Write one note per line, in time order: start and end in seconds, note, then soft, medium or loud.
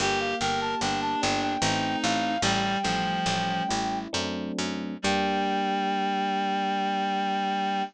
0.00 0.34 G1 loud
0.00 0.81 A#3 medium
0.00 0.35 G4 loud
0.00 0.19 G5 medium
0.20 0.39 F5 medium
0.40 0.75 G1 medium
0.40 1.57 G4 medium
0.40 0.75 A#4 medium
0.40 0.60 G5 medium
0.61 0.80 A5 medium
0.81 1.16 G1 medium
0.81 1.58 A#3 medium
0.81 1.53 D4 medium
0.81 1.00 G5 medium
1.02 1.21 A5 medium
1.22 1.57 G1 loud
1.22 1.60 D4 medium
1.22 1.41 G5 medium
1.42 1.61 G5 medium
1.61 1.96 A1 loud
1.61 2.35 A3 medium
1.61 2.35 C4 loud
1.61 2.35 D#4 loud
1.61 2.36 D#4 medium
1.61 1.98 G5 medium
2.03 2.38 A1 loud
2.03 2.42 F5 medium
2.42 2.77 A1 loud
2.42 2.78 G3 loud
2.42 4.04 G3 loud
2.42 3.98 G5 medium
2.83 3.20 A1 medium
2.83 3.63 F3 loud
2.83 4.06 A3 medium
3.26 3.62 A1 medium
3.26 4.08 C#4 medium
3.69 4.08 A1 medium
3.69 4.10 E4 medium
4.13 4.52 F#2 loud
4.13 4.94 F#3 loud
4.13 4.94 A3 loud
4.13 4.94 C4 medium
4.13 4.94 D4 medium
4.59 4.98 F#2 medium
5.02 7.84 G2 loud
5.02 7.82 G3 loud
5.02 7.84 A#3 medium
5.02 7.84 D4 medium
5.02 7.84 G4 loud
5.02 7.84 G5 loud